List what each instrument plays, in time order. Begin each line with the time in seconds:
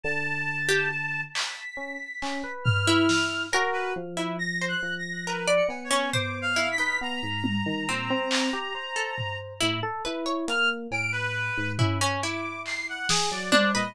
0.03 electric piano 1 D3, clarinet A5
0.68 orchestral harp G4
1.34 clarinet B6, clap
1.77 electric piano 1 C#4
2.22 electric piano 1 C#4, clap
2.43 electric piano 1 B4
2.64 clarinet F6, floor tom
2.87 orchestral harp E4
3.09 snare
3.53 electric piano 1 F#4, orchestral harp A#4, cowbell
3.73 clarinet B4
3.96 electric piano 1 F3
4.17 orchestral harp E4
4.39 clarinet A#6
4.61 orchestral harp C5
4.68 clarinet F#6
4.83 electric piano 1 F3
4.99 clarinet A#6
5.27 orchestral harp A#4, clarinet B4
5.47 orchestral harp D5
5.56 clarinet C#7
5.68 electric piano 1 B3, cowbell
5.84 clarinet C#5
5.91 orchestral harp C#4
6.13 orchestral harp C5, clarinet D6, floor tom
6.42 clarinet F5
6.56 orchestral harp E4
6.72 clarinet B6
6.78 orchestral harp D#4, electric piano 1 B4
7.01 electric piano 1 B3, clarinet A#5
7.23 electric piano 1 G#2
7.44 high tom
7.66 electric piano 1 D#3
7.89 electric piano 1 A#2, orchestral harp C4
8.10 electric piano 1 C4
8.31 clap
8.53 electric piano 1 G4
8.75 electric piano 1 C5
8.96 orchestral harp A4
9.18 floor tom
9.61 electric piano 1 A2, orchestral harp E4
9.83 electric piano 1 A4
10.05 electric piano 1 E4, orchestral harp B4
10.26 orchestral harp C#5
10.48 electric piano 1 A#3, clarinet F6, closed hi-hat
10.91 electric piano 1 A2, clarinet D7, cowbell
11.12 clarinet B4
11.57 electric piano 1 G#2
11.79 electric piano 1 C#4, orchestral harp E4, floor tom
12.01 orchestral harp C#4
12.22 orchestral harp E4, clarinet D6
12.66 clarinet C7, clap
12.89 clarinet F#5
13.09 electric piano 1 G#4, snare
13.31 electric piano 1 F#3, clarinet D5
13.52 orchestral harp D4, electric piano 1 C5, high tom
13.74 electric piano 1 A#2, orchestral harp B4, clarinet D#5